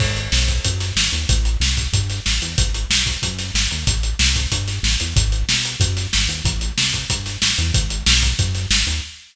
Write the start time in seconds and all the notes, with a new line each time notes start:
0.00 G#1, kick, crash
0.16 closed hi-hat
0.32 B1, snare
0.48 kick, closed hi-hat
0.65 F#2, kick, closed hi-hat
0.80 snare, closed hi-hat
0.96 G#1, snare
1.12 D#2, closed hi-hat
1.29 A1, kick, closed hi-hat
1.45 closed hi-hat
1.60 C2, snare
1.77 kick, closed hi-hat
1.93 G2, kick, closed hi-hat
2.10 snare, closed hi-hat
2.26 A1, snare
2.42 E2, closed hi-hat
2.58 G#1, kick, closed hi-hat
2.74 closed hi-hat
2.90 B1, snare
3.06 kick, closed hi-hat
3.22 F#2, kick, closed hi-hat
3.39 snare, closed hi-hat
3.54 G#1, snare
3.71 D#2, closed hi-hat
3.87 A1, kick, closed hi-hat
4.03 closed hi-hat
4.19 C2, snare
4.36 kick, closed hi-hat
4.52 G2, kick, closed hi-hat
4.68 snare, closed hi-hat
4.83 A1, snare
5.00 E2, closed hi-hat
5.16 G#1, kick, closed hi-hat
5.32 closed hi-hat
5.48 B1, snare
5.65 closed hi-hat
5.80 F#2, kick, closed hi-hat
5.97 snare, closed hi-hat
6.13 G#1, snare
6.28 D#2, closed hi-hat
6.44 A1, kick, closed hi-hat
6.61 closed hi-hat
6.78 C2, snare
6.93 kick, closed hi-hat
7.10 G2, kick, closed hi-hat
7.26 snare, closed hi-hat
7.41 A1, snare
7.58 E2, closed hi-hat
7.74 G#1, kick, closed hi-hat
7.90 closed hi-hat
8.06 B1, snare
8.23 kick, closed hi-hat
8.39 F#2, kick, closed hi-hat
8.55 snare, closed hi-hat
8.70 G#1, snare
8.87 D#2, closed hi-hat